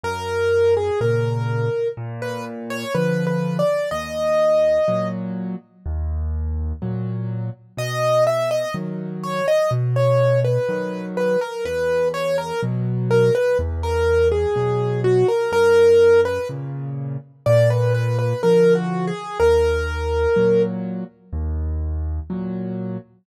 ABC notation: X:1
M:4/4
L:1/16
Q:1/4=62
K:B
V:1 name="Acoustic Grand Piano"
A3 G A4 z B z c (3B2 B2 =d2 | d6 z10 | d2 e d z2 c d z c2 B3 B A | B2 c A z2 A B z A2 G3 F A |
A3 B z4 =d B B B (3A2 F2 G2 | A6 z10 |]
V:2 name="Acoustic Grand Piano" clef=bass
F,,4 [A,,C,]4 A,,4 [=D,^E,]4 | D,,4 [A,,F,]4 D,,4 [A,,F,]4 | B,,4 [D,F,]4 B,,4 [D,F,]4 | E,,4 [B,,F,]4 E,,4 [B,,F,]4 |
F,,4 [A,,C,]4 A,,4 [=D,^E,]4 | D,,4 [A,,F,]4 D,,4 [A,,F,]4 |]